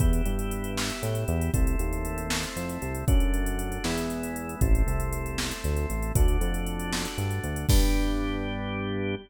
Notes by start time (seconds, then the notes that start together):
0.00 E2 B3 E4 G4, kick, closed hi-hat
0.13 closed hi-hat
0.26 G2, closed hi-hat
0.39 closed hi-hat
0.51 closed hi-hat
0.64 closed hi-hat
0.77 snare
0.90 closed hi-hat
1.03 A2, closed hi-hat
1.15 closed hi-hat
1.28 E2, closed hi-hat
1.41 closed hi-hat
1.54 C2 A3 C4 E4, kick, closed hi-hat
1.67 closed hi-hat
1.79 D#2, closed hi-hat
1.93 closed hi-hat
2.05 closed hi-hat
2.18 closed hi-hat
2.30 snare
2.43 closed hi-hat
2.56 F2, closed hi-hat
2.69 closed hi-hat
2.82 C2, closed hi-hat
2.95 closed hi-hat
3.08 F#2 A3 D4 F#4, kick, closed hi-hat
3.20 closed hi-hat
3.34 closed hi-hat
3.46 closed hi-hat
3.59 closed hi-hat
3.72 closed hi-hat
3.84 E2 G#3 B3 E4, snare
3.98 closed hi-hat
4.10 closed hi-hat
4.23 closed hi-hat
4.36 closed hi-hat
4.49 closed hi-hat
4.61 A1 A3 C4 E4, kick, closed hi-hat
4.75 closed hi-hat
4.87 C2, closed hi-hat
5.00 closed hi-hat
5.13 closed hi-hat
5.26 closed hi-hat
5.38 snare
5.51 closed hi-hat
5.64 D2, closed hi-hat
5.76 closed hi-hat
5.90 A1, closed hi-hat
6.02 closed hi-hat
6.15 D2 A3 D4 F#4, kick, closed hi-hat
6.28 closed hi-hat
6.41 F2, closed hi-hat
6.54 closed hi-hat
6.66 closed hi-hat
6.79 closed hi-hat
6.93 snare
7.05 closed hi-hat
7.18 G2, closed hi-hat
7.31 closed hi-hat
7.44 D2, closed hi-hat
7.56 closed hi-hat
7.69 G2 B3 D4 G4, kick, crash